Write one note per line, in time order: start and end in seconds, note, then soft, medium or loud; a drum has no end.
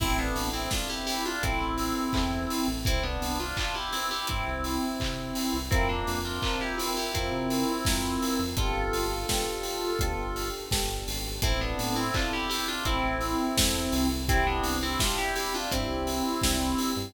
0.00 0.32 A1 medium
0.00 0.64 C4 medium
0.00 0.17 C4 loud
0.00 0.64 E4 medium
0.00 0.17 E4 loud
0.00 0.64 A4 medium
0.00 kick loud
0.00 crash loud
0.19 0.49 B3 medium
0.19 0.49 D4 medium
0.36 0.68 A1 medium
0.36 open hi-hat medium
0.53 0.70 C4 medium
0.53 0.70 E4 medium
0.71 1.36 C4 medium
0.71 0.88 D4 medium
0.71 1.36 E4 medium
0.71 0.88 F4 loud
0.71 1.36 A4 medium
0.71 kick medium
0.71 snare loud
0.89 1.06 E4 medium
0.89 1.06 G4 medium
1.07 1.24 E4 medium
1.07 1.24 G4 loud
1.07 open hi-hat medium
1.25 1.42 D4 medium
1.25 1.42 F4 loud
1.43 1.59 A1 medium
1.43 2.67 C4 medium
1.43 2.07 C4 medium
1.43 2.67 E4 loud
1.43 2.07 E4 medium
1.43 2.07 A4 medium
1.43 kick loud
1.43 closed hi-hat loud
1.61 1.93 A1 medium
1.78 open hi-hat medium
2.13 2.46 E2 medium
2.13 2.78 C4 medium
2.13 2.78 E4 medium
2.13 2.78 A4 medium
2.13 kick loud
2.13 clap loud
2.50 open hi-hat medium
2.68 2.84 A1 medium
2.85 3.18 C2 medium
2.85 3.03 C4 loud
2.85 3.03 E4 loud
2.85 kick loud
2.85 closed hi-hat loud
3.03 3.38 B3 medium
3.03 3.38 D4 loud
3.21 3.53 C2 medium
3.21 open hi-hat medium
3.40 3.57 D4 medium
3.40 3.57 F4 medium
3.57 3.75 D4 medium
3.57 3.75 F4 loud
3.57 kick medium
3.57 clap loud
3.75 3.92 E4 medium
3.75 3.92 G4 loud
3.93 4.10 C4 medium
3.93 4.10 E4 loud
3.93 open hi-hat medium
4.11 4.28 E4 medium
4.11 4.28 G4 loud
4.27 4.45 G2 medium
4.27 5.57 C4 medium
4.27 5.57 E4 medium
4.27 kick medium
4.27 closed hi-hat loud
4.46 4.79 C2 medium
4.64 open hi-hat medium
5.00 5.32 C3 medium
5.00 kick medium
5.00 clap loud
5.35 open hi-hat medium
5.54 5.70 C2 medium
5.71 6.04 F2 medium
5.71 5.88 C4 medium
5.71 6.35 C4 medium
5.71 5.88 E4 loud
5.71 6.35 F4 medium
5.71 6.35 A#4 medium
5.71 kick loud
5.71 closed hi-hat loud
5.89 6.19 A#3 medium
5.89 6.19 D4 loud
6.07 6.39 F2 medium
6.07 open hi-hat medium
6.25 6.42 D4 medium
6.25 6.42 F4 medium
6.42 7.07 C4 medium
6.42 6.60 D4 medium
6.42 7.07 F4 medium
6.42 6.60 F4 medium
6.42 7.07 A#4 medium
6.42 kick medium
6.42 clap loud
6.61 6.77 E4 medium
6.61 6.78 G4 medium
6.78 6.95 C4 medium
6.78 6.95 E4 medium
6.78 open hi-hat loud
6.97 7.14 E4 medium
6.97 7.14 G4 medium
7.14 7.30 F2 medium
7.14 8.41 C4 medium
7.14 7.79 C4 medium
7.14 8.41 E4 loud
7.14 7.79 F4 medium
7.14 7.79 A#4 medium
7.14 kick medium
7.14 closed hi-hat loud
7.32 7.64 C3 medium
7.50 open hi-hat medium
7.85 8.18 F2 medium
7.85 8.50 C4 medium
7.85 8.50 F4 medium
7.85 8.50 A#4 medium
7.85 kick loud
7.85 snare loud
8.22 open hi-hat medium
8.39 8.55 F2 medium
8.57 8.89 G1 medium
8.57 9.22 B3 medium
8.57 9.22 D4 medium
8.57 10.49 F4 medium
8.57 9.22 G4 medium
8.57 9.22 A4 medium
8.57 10.49 A4 loud
8.57 kick loud
8.57 closed hi-hat loud
8.93 9.25 G1 medium
8.93 open hi-hat medium
9.28 9.93 B3 medium
9.28 9.93 D4 medium
9.28 9.93 G4 medium
9.28 9.93 A4 medium
9.28 kick medium
9.28 snare loud
9.63 open hi-hat medium
9.99 10.16 D2 medium
9.99 10.65 B3 medium
9.99 10.65 D4 medium
9.99 10.65 G4 medium
9.99 10.65 A4 medium
9.99 kick loud
9.99 closed hi-hat loud
10.18 10.50 G1 medium
10.36 open hi-hat medium
10.71 11.04 G1 medium
10.71 11.36 B3 medium
10.71 11.36 D4 medium
10.71 11.36 G4 medium
10.71 11.36 A4 medium
10.71 kick medium
10.71 snare loud
11.07 11.39 G#1 medium
11.07 open hi-hat medium
11.42 11.75 A1 medium
11.42 12.07 C4 medium
11.42 11.60 C4 loud
11.42 12.07 E4 medium
11.42 11.60 E4 loud
11.42 12.07 A4 loud
11.42 kick loud
11.42 closed hi-hat loud
11.61 11.96 B3 medium
11.61 11.96 D4 loud
11.78 12.11 A2 medium
11.78 open hi-hat medium
11.96 12.13 C4 medium
11.96 12.13 E4 loud
12.14 12.78 C4 medium
12.14 12.32 D4 medium
12.14 12.78 E4 medium
12.14 12.32 F4 loud
12.14 12.78 A4 medium
12.14 kick loud
12.14 clap loud
12.33 12.49 E4 medium
12.33 12.49 G4 loud
12.49 12.66 E4 loud
12.49 12.66 G4 loud
12.49 open hi-hat medium
12.68 12.85 D4 medium
12.68 12.85 F4 loud
12.85 13.02 A1 medium
12.85 14.07 C4 medium
12.85 13.50 C4 medium
12.85 14.07 E4 loud
12.85 13.50 E4 medium
12.85 13.50 A4 medium
12.85 kick medium
12.85 closed hi-hat loud
13.04 13.36 A1 medium
13.21 open hi-hat medium
13.57 13.89 E2 medium
13.57 14.21 C4 medium
13.57 14.21 E4 medium
13.57 14.21 A4 medium
13.57 kick loud
13.57 snare loud
13.92 14.61 C2 medium
13.92 open hi-hat medium
14.29 14.93 C4 medium
14.29 14.46 C4 loud
14.29 14.93 D4 medium
14.29 14.93 E4 medium
14.29 14.46 E4 loud
14.29 14.93 G4 medium
14.29 kick loud
14.29 closed hi-hat loud
14.47 14.77 B3 medium
14.47 14.77 D4 loud
14.64 14.96 C2 medium
14.64 open hi-hat medium
14.83 15.00 C4 loud
14.83 15.00 E4 loud
15.00 15.64 C4 medium
15.00 15.64 D4 medium
15.00 15.17 D4 medium
15.00 15.64 E4 medium
15.00 15.17 F4 medium
15.00 15.64 G4 medium
15.00 kick loud
15.00 snare loud
15.18 15.35 E4 medium
15.18 15.35 G4 loud
15.36 15.53 E4 medium
15.36 15.53 G4 loud
15.36 open hi-hat medium
15.54 15.71 D4 medium
15.54 15.71 F4 loud
15.71 15.87 G2 medium
15.71 16.92 C4 medium
15.71 16.36 C4 medium
15.71 16.36 D4 medium
15.71 16.92 E4 loud
15.71 16.36 E4 medium
15.71 16.36 G4 medium
15.71 kick medium
15.71 closed hi-hat loud
15.89 16.21 C2 medium
16.07 open hi-hat medium
16.42 16.75 C2 medium
16.42 17.07 C4 medium
16.42 17.07 D4 medium
16.42 17.07 E4 medium
16.42 17.07 G4 medium
16.42 kick medium
16.42 snare loud
16.78 open hi-hat medium
16.96 17.13 G2 medium